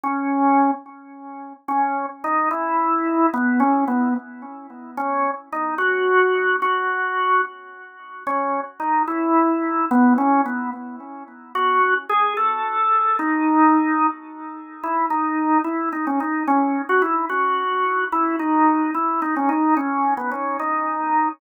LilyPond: \new Staff { \time 6/8 \key cis \minor \tempo 4. = 73 cis'4. r4. | cis'8. r16 dis'8 e'4. | b8 cis'8 b8 r4. | cis'8. r16 dis'8 fis'4. |
fis'4. r4. | cis'8. r16 dis'8 e'4. | b8 cis'8 b8 r4. | fis'8. r16 gis'8 a'4. |
dis'2 r4 | \key e \major e'8 dis'4 e'8 dis'16 cis'16 dis'8 | cis'8. fis'16 e'8 fis'4. | e'8 dis'4 e'8 dis'16 cis'16 dis'8 |
cis'8. b16 cis'8 dis'4. | }